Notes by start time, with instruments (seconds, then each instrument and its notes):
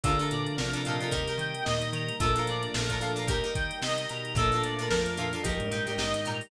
0.03 electric bass (finger) A#1, glockenspiel D3 D4, string ensemble 1 F3 A3 A#3 D4, pizzicato strings D4 F4 A4 A#4, drawbar organ F4 A4 A#4 D5, clarinet A4, kick, closed hi-hat
0.19 pizzicato strings D4 F4 A4 A#4, closed hi-hat
0.31 electric bass (finger) A#2, clarinet D5, closed hi-hat
0.47 closed hi-hat
0.57 electric bass (finger) A#1, glockenspiel C3 C4, string ensemble 1 F3 A3 D4 F4, drawbar organ F4 A4 A#4 D5, clarinet A#4, snare
0.73 pizzicato strings D4 F4 A4 A#4, closed hi-hat
0.85 electric bass (finger) A#2, pizzicato strings D4 F4 A4, drawbar organ G4 A#4 D#5, clarinet F5, closed hi-hat
0.89 pizzicato strings A#4
1.00 pizzicato strings D4 F4 A4 A#4, closed hi-hat
1.11 electric bass (finger) D#2, string ensemble 1 G3 A#3 D#4, pizzicato strings D#4 G4 A#4, clarinet A#4, kick, closed hi-hat
1.28 pizzicato strings D#4 G4 A#4, closed hi-hat
1.38 electric bass (finger) D#3, clarinet G5, closed hi-hat
1.55 closed hi-hat
1.64 electric bass (finger) D#2, glockenspiel A#2 A#3, string ensemble 1 D#3 G3 D#4, drawbar organ G4 A#4 D#5, clarinet D#5, snare
1.82 closed hi-hat
1.93 electric bass (finger) D#3, clarinet A#5, closed hi-hat
2.09 closed hi-hat
2.20 electric bass (finger) A#1, glockenspiel A#2 A#3, string ensemble 1 F3 A3 A#3 D4, pizzicato strings D4 F4 A4 A#4, drawbar organ F4 A4 A#4 D5, clarinet A4, kick, closed hi-hat
2.36 pizzicato strings D4 F4 A4 A#4, closed hi-hat
2.47 electric bass (finger) A#2, clarinet D5, closed hi-hat
2.63 closed hi-hat
2.74 electric bass (finger) A#1, glockenspiel A#2 A#3, string ensemble 1 F3 A3 D4 F4, drawbar organ F4 A4 A#4 D5, clarinet A#4, snare
2.89 pizzicato strings D4 F4 A4 A#4, kick, snare, closed hi-hat
3.01 electric bass (finger) A#2, pizzicato strings D4 F4 A4 A#4, clarinet F5, closed hi-hat
3.16 pizzicato strings D4 F4 A4 A#4, closed hi-hat
3.27 electric bass (finger) D#2, string ensemble 1 G3 A#3 D#4, pizzicato strings D#4 G4 A#4, drawbar organ G4 A#4 D#5, clarinet A#4, kick, closed hi-hat
3.44 pizzicato strings D#4 G4 A#4, closed hi-hat
3.55 electric bass (finger) D#3, clarinet G5, kick, closed hi-hat
3.71 closed hi-hat
3.82 electric bass (finger) C3, string ensemble 1 D#3 G3 D#4, drawbar organ G4 A#4 D#5, clarinet D#5, snare
3.98 closed hi-hat
4.09 electric bass (finger) B2, clarinet A#5, closed hi-hat
4.25 closed hi-hat
4.35 electric bass (finger) A#1, glockenspiel A#2 A#3, string ensemble 1 F3 A3 A#3 D4, drawbar organ A#3 D4 F4 A4, pizzicato strings D4 F4 A4, clarinet A4, kick, closed hi-hat
4.40 pizzicato strings A#4
4.52 pizzicato strings D4 F4 A4, snare, closed hi-hat
4.56 pizzicato strings A#4
4.64 electric bass (finger) A#2, clarinet D5, closed hi-hat
4.79 pizzicato strings D4 F4 A4 A#4, closed hi-hat
4.90 electric bass (finger) A#1, glockenspiel F2 F3, string ensemble 1 F3 A3 D4 F4, clarinet A#4, snare
5.06 closed hi-hat
5.17 electric bass (finger) A#2, pizzicato strings D4 F4 A4 A#4, clarinet F5, closed hi-hat
5.33 pizzicato strings D4 F4 A4 A#4, closed hi-hat
5.43 electric bass (finger) A#1, glockenspiel F2 F3, string ensemble 1 G3 A#3 D#4, drawbar organ A#3 D#4 G4, pizzicato strings D#4 G4 A#4, clarinet A#4, kick, closed hi-hat
5.60 glockenspiel G#2 G#3, closed hi-hat
5.71 electric bass (finger) A#2, pizzicato strings D#4 G4 A#4, clarinet G5, closed hi-hat
5.87 glockenspiel G#2 G#3, pizzicato strings D#4 G4 A#4, closed hi-hat
5.98 electric bass (finger) A#1, string ensemble 1 D#3 G3 D#4, pizzicato strings D#4 G4 A#4, clarinet D#5, snare
6.14 closed hi-hat
6.25 electric bass (finger) A#2, pizzicato strings D#4 G4 A#4, clarinet A#5, snare, closed hi-hat
6.41 open hi-hat